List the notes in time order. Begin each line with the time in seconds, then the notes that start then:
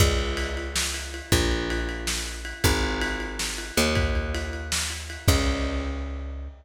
0.00 C#2, kick, crash
0.19 ride
0.37 ride
0.57 ride
0.76 snare
0.94 ride
1.14 ride
1.32 A#1, kick, ride
1.51 ride
1.70 ride
1.89 ride
2.07 snare
2.27 ride
2.45 ride
2.64 G#1, kick, ride
2.84 ride
3.01 ride
3.20 ride
3.39 snare
3.58 ride
3.77 D#2, ride
3.95 kick, ride
4.15 ride
4.35 ride
4.53 ride
4.72 snare
4.90 ride
5.10 ride
5.28 C#2, kick, crash